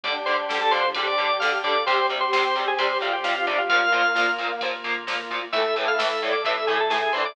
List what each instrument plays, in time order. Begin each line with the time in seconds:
0.04 synth bass 1 D2, overdriven guitar D3 G3, pad 2 (warm) D4 G4, drawbar organ D4 G4 D5, brass section D4, kick, ride
0.26 overdriven guitar D3 G3, brass section D4, drawbar organ C5, ride
0.49 synth bass 1 D2, overdriven guitar D3 G3, brass section G3, snare
0.61 drawbar organ A4
0.71 synth bass 1 D2, overdriven guitar D3 G3, brass section F3, drawbar organ C5, ride
0.94 synth bass 1 C3, overdriven guitar D3 G3, drawbar organ D4 G4, brass section G4, kick, ride
1.07 drawbar organ D5
1.18 overdriven guitar D3 G3, synth bass 1 D3, ride
1.40 overdriven guitar D3 G3, drawbar organ F5, snare
1.63 synth bass 1 D2, overdriven guitar D3 G3, brass section A4, drawbar organ D5, kick, ride
1.85 synth bass 1 D2, overdriven guitar C3 G3, pad 2 (warm) C4 G4, drawbar organ C4 G4 C5, brass section G4, kick, ride
2.09 overdriven guitar C3 G3, ride
2.21 drawbar organ C5
2.32 synth bass 1 D2, overdriven guitar C3 G3, drawbar organ C5, snare
2.55 synth bass 1 D2, overdriven guitar C3 G3, ride
2.68 drawbar organ G#4
2.78 synth bass 1 C3, overdriven guitar C3 G3, drawbar organ C4 G4 C5, kick, ride
3.01 overdriven guitar C3 G3, synth bass 1 D3, drawbar organ F4, ride
3.13 drawbar organ G4
3.24 overdriven guitar C3 G3, drawbar organ F4, snare
3.35 drawbar organ F4
3.47 synth bass 1 D2, overdriven guitar C3 G3, drawbar organ D4, ride
3.58 drawbar organ F4
3.69 synth bass 1 D2, overdriven guitar A#2 F3, drawbar organ A#3 F4 F5, pad 2 (warm) A#3 F4, brass section A#3, kick, ride
3.92 overdriven guitar A#2 F3, ride
4.15 synth bass 1 D2, overdriven guitar A#2 F3, snare
4.38 synth bass 1 D2, overdriven guitar A#2 F3, ride
4.61 overdriven guitar A#2 F3, synth bass 1 C3, drawbar organ A#3 F4, kick, ride
4.84 overdriven guitar A#2 F3, synth bass 1 D3, ride
5.07 overdriven guitar A#2 F3, snare
5.30 synth bass 1 D2, overdriven guitar A#2 F3, kick, ride
5.52 synth bass 1 D2, overdriven guitar A2 E3, drawbar organ A3 E4 E5, pad 2 (warm) A4 E5, brass section A4, kick, ride
5.76 overdriven guitar A2 E3, brass section A4, ride
5.88 drawbar organ F5
5.99 synth bass 1 D2, overdriven guitar A2 E3, drawbar organ E5, brass section E5, snare
6.22 synth bass 1 D2, overdriven guitar A2 E3, brass section D5, ride
6.32 drawbar organ D5
6.44 overdriven guitar A2 E3, synth bass 1 C3, drawbar organ A3 E4 E5, brass section A4, kick, ride
6.67 overdriven guitar A2 E3, synth bass 1 D3, drawbar organ G#4, ride
6.80 drawbar organ A4
6.90 overdriven guitar A2 E3, drawbar organ G#4, snare
7.02 drawbar organ G#4
7.13 synth bass 1 D2, overdriven guitar A2 E3, brass section D4, drawbar organ C5, ride
7.25 drawbar organ D5